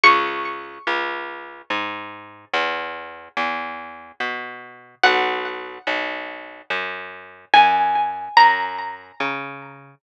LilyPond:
<<
  \new Staff \with { instrumentName = "Pizzicato Strings" } { \time 3/4 \key fis \mixolydian \tempo 4 = 72 cis'''2. | r2. | fis''2. | gis''4 ais''2 | }
  \new Staff \with { instrumentName = "Electric Bass (finger)" } { \clef bass \time 3/4 \key fis \mixolydian cis,4 cis,4 gis,4 | e,4 e,4 b,4 | b,,4 b,,4 fis,4 | fis,4 fis,4 cis4 | }
>>